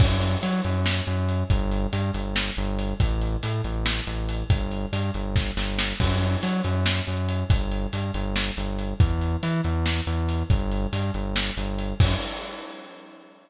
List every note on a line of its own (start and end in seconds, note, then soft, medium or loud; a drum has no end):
0.00 0.36 F#2 medium
0.00 kick loud
0.00 crash loud
0.21 closed hi-hat medium
0.43 0.61 F#3 medium
0.43 closed hi-hat loud
0.64 1.01 F#2 medium
0.64 closed hi-hat medium
0.86 snare loud
1.07 1.43 F#2 medium
1.07 closed hi-hat medium
1.29 closed hi-hat medium
1.50 1.87 G1 loud
1.50 kick medium
1.50 closed hi-hat medium
1.71 closed hi-hat medium
1.93 2.11 G2 medium
1.93 closed hi-hat medium
2.14 2.51 G1 medium
2.14 closed hi-hat medium
2.36 snare loud
2.57 2.94 G1 medium
2.57 closed hi-hat medium
2.79 closed hi-hat medium
3.00 3.36 A1 medium
3.00 kick medium
3.00 closed hi-hat loud
3.21 closed hi-hat medium
3.43 3.61 A2 medium
3.43 closed hi-hat loud
3.64 4.01 A1 medium
3.64 closed hi-hat medium
3.86 snare loud
4.07 4.43 A1 medium
4.07 closed hi-hat medium
4.29 closed hi-hat medium
4.50 4.86 G1 medium
4.50 kick loud
4.50 closed hi-hat loud
4.71 closed hi-hat medium
4.92 5.11 G2 medium
4.92 closed hi-hat loud
5.14 5.51 G1 medium
5.14 closed hi-hat medium
5.36 kick medium
5.36 snare medium
5.57 5.93 G1 medium
5.57 snare medium
5.79 snare loud
6.00 6.36 F#2 medium
6.00 kick medium
6.00 crash medium
6.22 closed hi-hat medium
6.43 6.61 F#3 medium
6.43 closed hi-hat loud
6.64 7.01 F#2 medium
6.64 closed hi-hat medium
6.86 snare loud
7.07 7.44 F#2 medium
7.07 closed hi-hat medium
7.29 closed hi-hat medium
7.50 7.87 G1 medium
7.50 kick loud
7.50 closed hi-hat loud
7.72 closed hi-hat medium
7.93 8.11 G2 medium
7.93 closed hi-hat medium
8.14 8.51 G1 medium
8.14 closed hi-hat medium
8.36 snare loud
8.57 8.94 G1 medium
8.57 closed hi-hat medium
8.79 closed hi-hat medium
9.00 9.36 E2 medium
9.00 kick loud
9.00 closed hi-hat medium
9.21 closed hi-hat medium
9.43 9.61 E3 medium
9.43 closed hi-hat medium
9.64 10.01 E2 medium
9.64 closed hi-hat medium
9.86 snare medium
10.07 10.43 E2 medium
10.07 closed hi-hat medium
10.29 closed hi-hat medium
10.50 10.87 G1 medium
10.50 kick loud
10.50 closed hi-hat medium
10.71 closed hi-hat medium
10.93 11.11 G2 medium
10.93 closed hi-hat loud
11.14 11.51 G1 medium
11.14 closed hi-hat medium
11.36 snare loud
11.57 11.94 G1 medium
11.57 closed hi-hat medium
11.79 closed hi-hat medium
12.00 12.15 F#2 medium
12.00 kick loud
12.00 crash loud